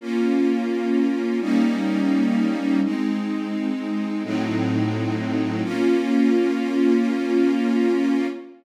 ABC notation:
X:1
M:4/4
L:1/8
Q:1/4=85
K:Bbm
V:1 name="String Ensemble 1"
[B,DF]4 [=G,B,DE]4 | [A,CE]4 [=A,,G,CE]4 | [B,DF]8 |]